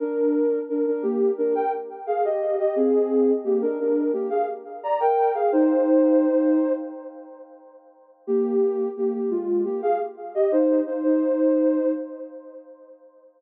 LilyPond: \new Staff { \time 4/4 \key c \minor \tempo 4 = 87 <d' bes'>4 <d' bes'>16 <d' bes'>16 <bes g'>8 <d' bes'>16 <bes' g''>16 r8 <aes' f''>16 <g' ees''>8 <g' ees''>16 | <c' aes'>4 <bes g'>16 <d' bes'>16 <d' bes'>8 <bes g'>16 <aes' f''>16 r8 <d'' bes''>16 <bes' g''>8 <aes' f''>16 | <ees' c''>2 r2 | <bes g'>4 <bes g'>16 <bes g'>16 <aes f'>8 <bes g'>16 <aes' f''>16 r8 <g' ees''>16 <ees' c''>8 <ees' c''>16 |
<ees' c''>4. r2 r8 | }